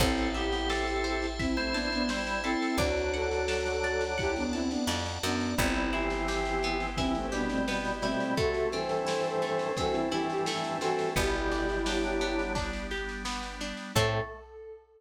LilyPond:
<<
  \new Staff \with { instrumentName = "Flute" } { \time 4/4 \key a \dorian \tempo 4 = 86 <c' e'>8 <e' g'>4. <c' e'>16 <a c'>16 <b d'>16 <b d'>16 r8 <c' e'>8 | <d' fis'>8 <fis' a'>4. <e' g'>16 <b d'>16 <c' e'>16 <b d'>16 r8 <b d'>8 | <c' e'>8 <e' g'>4. <c' e'>16 <a c'>16 <b d'>16 <a c'>16 r8 <a c'>8 | <fis' a'>8 <a' c''>4. <fis' a'>16 <c' e'>16 <e' g'>16 <e' g'>16 r8 <fis' a'>8 |
<e' g'>2 r2 | a'4 r2. | }
  \new Staff \with { instrumentName = "Drawbar Organ" } { \time 4/4 \key a \dorian <c' a'>8 <b g'>8 <c' a'>4 r16 <e' c''>16 <e' c''>8 <g e'>8 <c' a'>8 | <fis d'>2~ <fis d'>8 r4. | <g e'>8 <e c'>4. <g, e>8 <b, g>4 <b, g>8 | <c a>8 <g, e>4. <g, e>8 <g, e>4 <g, e>8 |
<b, g>4 <fis d'>4 r2 | a4 r2. | }
  \new Staff \with { instrumentName = "Pizzicato Strings" } { \time 4/4 \key a \dorian c''8 e''8 a''8 c''8 e''8 a''8 c''8 e''8 | d''8 fis''8 a''8 d''8 fis''8 a''8 d''8 fis''8 | b8 e'8 g'8 b8 e'8 g'8 b8 e'8 | a8 c'8 e'8 a8 c'8 e'8 a8 c'8 |
b8 d'8 g'8 b8 d'8 g'8 b8 d'8 | <c' e' a'>4 r2. | }
  \new Staff \with { instrumentName = "Electric Bass (finger)" } { \clef bass \time 4/4 \key a \dorian a,,1 | d,2. f,8 fis,8 | g,,1 | r1 |
g,,1 | a,4 r2. | }
  \new Staff \with { instrumentName = "Drawbar Organ" } { \time 4/4 \key a \dorian <c'' e'' a''>1 | <d'' fis'' a''>1 | <b e' g'>1 | <a c' e'>1 |
<g b d'>1 | <c' e' a'>4 r2. | }
  \new DrumStaff \with { instrumentName = "Drums" } \drummode { \time 4/4 <cymc bd sn>16 sn16 sn16 sn16 sn16 sn16 sn16 sn16 <bd sn>16 sn16 sn16 sn16 sn16 sn16 sn16 sn16 | <bd sn>16 sn16 sn16 sn16 sn16 sn16 sn16 sn16 <bd sn>16 sn16 sn16 sn16 sn16 sn16 sn16 sn16 | <bd sn>16 sn16 sn16 sn16 sn16 sn16 sn16 sn16 <bd sn>16 sn16 sn16 sn16 sn16 sn16 sn16 sn16 | <bd sn>16 sn16 sn16 sn16 sn16 sn16 sn16 sn16 <bd sn>16 sn16 sn16 sn16 sn16 sn16 sn16 sn16 |
<bd sn>16 sn16 sn16 sn16 sn16 sn16 sn16 sn16 <bd sn>16 sn16 sn16 sn16 sn16 sn16 sn16 sn16 | <cymc bd>4 r4 r4 r4 | }
>>